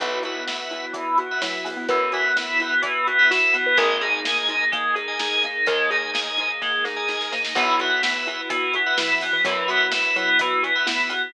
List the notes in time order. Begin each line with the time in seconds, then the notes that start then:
0.00 B1 E3 B3 E4 F#4 B4 E5 F#5, kick, closed hi-hat
0.22 B3 F#4 B4 E5 F#5, closed hi-hat
0.47 B3 E4 B4 E5 F#5, snare
0.70 B3 E4, snare, closed hi-hat
0.93 E3 B3, kick, closed hi-hat
1.18 B3 F#4, closed hi-hat
1.31 B4 E5 F#5
1.42 F#3 E4, snare
1.64 B3, open hi-hat
1.77 B3
1.88 F#2 E3 B3 B4, kick, closed hi-hat
2.12 B3 F#4 B4 E5 F#5, snare, closed hi-hat
2.36 B3 E4 B4 E5 F#5, snare
2.60 B3 E4, closed hi-hat
2.82 E3 B3, kick, closed hi-hat
3.07 B3 F#4, closed hi-hat
3.19 B4 E5 F#5
3.30 E4 F#4, snare
3.53 B3, snare, closed hi-hat
3.66 B4
3.77 G#1 G#3 A#3 D#4 G#4 A#4 D#5 G#5, kick, closed hi-hat
4.01 D#4 G#4 A#4 D#5 G#5, closed hi-hat
4.25 A#3 G#4 A#4 D#5 G#5, snare
4.49 D#4, closed hi-hat
4.72 G#3 A#3, kick, closed hi-hat
4.94 D#4 G#4, closed hi-hat
5.08 A#4 D#5 G#5
5.19 D#4 G#4, snare
5.43 A#3 D#4, closed hi-hat
5.66 D#2 G#3 A#3 A#4, kick, closed hi-hat
5.90 D#4 G#4 A#4 D#5 G#5, closed hi-hat
6.13 A#3 G#4 A#4 D#5 G#5, snare
6.38 D#4, closed hi-hat
6.61 G#3 A#3, kick, snare
6.84 D#4 G#4, snare
6.96 A#4 D#5 G#5
7.08 D#4 G#4, snare
7.21 snare
7.32 A#3 D#4, snare
7.45 snare
7.55 B1 E3 B3 E4 F#4 B4 E5 F#5, kick, closed hi-hat
7.79 B3 F#4 B4 E5 F#5, closed hi-hat
8.02 B3 E4 B4 E5 F#5, snare
8.26 B3 E4, snare, closed hi-hat
8.49 E3 B3, kick, closed hi-hat
8.74 B3 F#4, closed hi-hat
8.86 B4 E5 F#5
8.98 E3 E4, snare
9.21 B3, open hi-hat
9.33 E3
9.44 F#2 E3 F#3 B3, kick, closed hi-hat
9.68 B3 F#4 B4 E5 F#5, snare, closed hi-hat
9.91 B3 E4 B4 E5 F#5, snare
10.16 F#3 B3 E4, closed hi-hat
10.39 E3 B3, kick, closed hi-hat
10.63 B3 F#4, closed hi-hat
10.75 B4 E5 F#5
10.86 B3 E4, snare
11.09 B3, snare, closed hi-hat